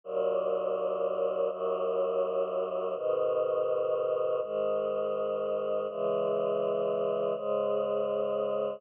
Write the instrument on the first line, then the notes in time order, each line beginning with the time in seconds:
choir aahs
0.04 D#2 A#2 F#3
1.50 D#2 F#2 F#3
2.95 G#2 B2 D#3
4.42 G#2 D#3 G#3
5.89 C#3 E3 G#3
7.36 G#2 C#3 G#3